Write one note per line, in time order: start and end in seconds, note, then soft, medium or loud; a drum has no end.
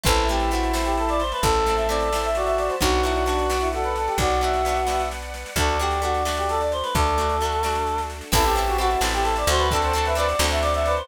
0.03 1.33 A1 medium
0.03 0.25 A3 medium
0.03 0.25 C4 loud
0.03 1.22 E4 medium
0.03 0.25 E4 medium
0.03 0.27 A4 loud
0.03 2.78 C5 medium
0.03 2.78 E5 medium
0.03 2.78 A5 loud
0.03 kick loud
0.03 snare medium
0.16 snare medium
0.28 0.50 A3 medium
0.28 0.50 C4 medium
0.28 0.50 G4 loud
0.28 snare medium
0.32 0.50 E4 medium
0.40 snare medium
0.51 0.73 A3 medium
0.51 0.73 C4 medium
0.51 0.73 E4 medium
0.51 0.73 F#4 medium
0.51 snare medium
0.63 snare medium
0.73 1.58 A3 medium
0.73 1.58 C4 medium
0.73 1.58 E4 medium
0.73 snare loud
0.85 0.96 G4 loud
0.85 snare medium
0.97 1.09 A4 medium
0.97 snare medium
1.09 1.20 D5 loud
1.09 snare medium
1.20 1.31 C5 medium
1.20 snare medium
1.32 1.43 B4 medium
1.32 snare medium
1.42 2.70 A1 medium
1.42 1.75 A4 loud
1.42 2.29 A4 medium
1.42 kick medium
1.42 snare medium
1.54 snare medium
1.66 1.88 A3 medium
1.66 1.88 C4 medium
1.66 1.88 E4 medium
1.66 snare medium
1.76 1.87 E5 loud
1.76 snare medium
1.89 2.10 A3 medium
1.89 2.10 C4 medium
1.89 2.10 E4 medium
1.89 2.17 D5 medium
1.89 snare medium
2.00 snare medium
2.12 2.76 A3 medium
2.12 2.76 C4 medium
2.12 2.76 E4 medium
2.12 snare loud
2.23 2.36 E5 loud
2.23 snare medium
2.35 2.75 F#4 medium
2.35 2.46 D5 medium
2.35 snare medium
2.45 2.56 E5 loud
2.45 snare medium
2.58 2.69 D5 loud
2.58 snare medium
2.69 2.80 C5 medium
2.69 snare medium
2.80 4.09 B1 medium
2.80 3.02 B3 medium
2.80 3.02 D4 loud
2.80 3.69 F#4 medium
2.80 3.00 F#4 loud
2.80 3.02 F#4 medium
2.80 5.54 B4 medium
2.80 5.54 D5 loud
2.80 5.54 F#5 loud
2.80 kick medium
2.80 snare medium
2.92 snare medium
3.03 3.25 B3 medium
3.03 3.25 D4 medium
3.03 3.22 E4 medium
3.03 3.25 F#4 medium
3.03 snare medium
3.15 snare medium
3.26 3.47 B3 medium
3.26 3.46 D4 medium
3.26 3.47 D4 medium
3.26 3.47 F#4 medium
3.26 snare medium
3.38 snare medium
3.50 4.34 B3 medium
3.50 4.34 D4 medium
3.50 4.34 F#4 medium
3.50 snare medium
3.61 3.71 E4 medium
3.61 snare medium
3.73 3.83 F#4 loud
3.73 4.16 A4 medium
3.73 snare medium
3.83 3.94 B4 loud
3.83 snare medium
3.95 4.08 A4 medium
3.95 snare medium
4.07 4.17 G4 medium
4.07 snare medium
4.18 5.45 B1 medium
4.18 5.02 F#4 loud
4.18 4.41 D5 medium
4.18 kick medium
4.18 snare medium
4.30 snare medium
4.41 4.62 B3 medium
4.41 4.62 D4 medium
4.41 4.62 F#4 medium
4.41 4.82 E5 medium
4.41 snare medium
4.53 snare medium
4.65 4.86 B3 medium
4.65 4.87 D4 medium
4.65 snare medium
4.69 4.87 F#4 medium
4.76 snare medium
4.87 5.50 B3 medium
4.87 5.50 D4 medium
4.87 5.50 F#4 medium
4.87 5.09 E5 medium
4.87 snare medium
4.99 snare medium
5.11 snare medium
5.22 snare medium
5.34 snare medium
5.46 snare medium
5.56 6.83 D2 medium
5.56 5.78 A3 medium
5.56 8.29 D4 medium
5.56 5.78 D4 medium
5.56 8.29 F#4 medium
5.56 5.78 F#4 medium
5.56 8.29 A4 medium
5.56 5.77 A4 loud
5.56 6.73 D5 medium
5.56 kick medium
5.56 snare medium
5.69 snare medium
5.79 6.01 A3 medium
5.79 6.01 D4 medium
5.79 6.01 F#4 medium
5.79 6.01 G4 loud
5.79 snare medium
5.91 snare medium
6.02 6.23 A3 medium
6.02 6.23 D4 medium
6.02 6.23 F#4 loud
6.02 6.23 F#4 medium
6.02 snare medium
6.14 snare medium
6.25 7.10 A3 medium
6.25 7.10 D4 medium
6.25 7.10 F#4 medium
6.25 snare loud
6.37 6.48 G4 medium
6.37 snare medium
6.49 6.60 A4 loud
6.49 snare medium
6.61 6.71 D5 loud
6.61 snare medium
6.72 6.83 C5 medium
6.72 snare medium
6.83 6.93 B4 medium
6.83 snare medium
6.94 8.22 D2 medium
6.94 8.01 A4 loud
6.94 7.36 D5 medium
6.94 kick medium
6.94 snare medium
7.06 snare medium
7.18 7.39 A3 medium
7.18 7.39 D4 medium
7.18 7.39 F#4 medium
7.18 snare medium
7.29 snare medium
7.41 7.62 A3 medium
7.41 7.63 D4 medium
7.41 snare medium
7.45 7.63 F#4 medium
7.52 snare medium
7.63 8.26 A3 medium
7.63 8.26 D4 medium
7.63 8.26 F#4 medium
7.63 snare medium
7.75 snare medium
7.87 snare medium
7.98 snare medium
8.10 snare medium
8.21 snare medium
8.32 8.96 A1 medium
8.32 8.53 C4 loud
8.32 8.44 E4 loud
8.32 8.53 E4 loud
8.32 8.54 A4 loud
8.32 8.53 A4 loud
8.32 9.69 C5 loud
8.32 9.69 E5 loud
8.32 9.69 A5 loud
8.32 kick loud
8.32 snare medium
8.32 crash loud
8.44 8.55 G4 medium
8.44 snare medium
8.54 8.77 C4 medium
8.54 8.77 E4 medium
8.54 8.76 G4 loud
8.54 snare medium
8.59 8.77 A4 loud
8.67 8.78 F#4 medium
8.67 snare medium
8.78 9.00 C4 medium
8.78 9.00 E4 medium
8.78 8.90 F#4 medium
8.78 9.01 F#4 loud
8.78 9.00 A4 loud
8.78 snare medium
8.90 snare medium
9.01 9.45 A1 medium
9.01 9.65 C4 medium
9.01 9.65 E4 medium
9.01 9.65 A4 medium
9.01 snare loud
9.13 9.24 G4 loud
9.13 snare medium
9.23 9.34 A4 loud
9.23 snare medium
9.36 9.48 D5 loud
9.36 snare medium
9.47 10.34 D2 medium
9.47 9.68 F#4 medium
9.47 9.60 C5 loud
9.47 snare medium
9.59 9.69 B4 loud
9.59 snare medium
9.71 9.93 C4 loud
9.71 9.93 D4 loud
9.71 9.82 A4 medium
9.71 10.05 A4 loud
9.71 11.07 C5 loud
9.71 11.07 D5 loud
9.71 11.07 F#5 loud
9.71 11.07 A5 loud
9.71 kick medium
9.71 snare medium
9.75 9.93 F#4 medium
9.75 9.93 A4 loud
9.82 9.93 C5 medium
9.82 snare medium
9.93 10.14 C4 medium
9.93 10.14 D4 medium
9.93 10.14 F#4 medium
9.93 snare medium
9.98 10.14 A4 loud
10.05 10.16 B4 medium
10.05 10.17 E5 loud
10.05 snare medium
10.15 10.36 C4 medium
10.15 10.36 D4 medium
10.15 10.36 F#4 medium
10.15 10.27 B4 medium
10.15 10.45 D5 loud
10.15 snare medium
10.20 10.36 A4 medium
10.29 snare medium
10.39 11.03 D2 medium
10.39 11.03 C4 medium
10.39 11.03 D4 medium
10.39 11.03 F#4 medium
10.39 snare loud
10.44 11.03 A4 medium
10.51 10.62 E5 loud
10.51 snare medium
10.62 10.73 D5 loud
10.62 snare medium
10.74 10.85 E5 loud
10.74 snare medium
10.85 11.05 B4 medium
10.85 10.96 D5 loud
10.85 snare medium
10.97 11.08 C5 loud
10.97 snare medium